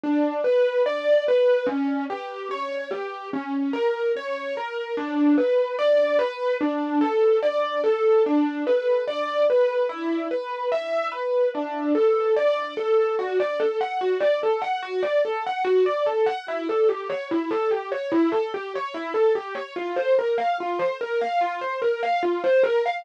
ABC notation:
X:1
M:4/4
L:1/16
Q:1/4=73
K:Bm
V:1 name="Acoustic Grand Piano"
D2 B2 d2 B2 C2 G2 c2 G2 | C2 ^A2 c2 A2 D2 B2 d2 B2 | D2 A2 d2 A2 D2 B2 d2 B2 | E2 B2 e2 B2 D2 A2 d2 A2 |
[K:D] F d A f F d A f F d A f F d A f | E A G c E A G c E A G c E A G c | =F =c _B =f F c B f F c B f F c B f |]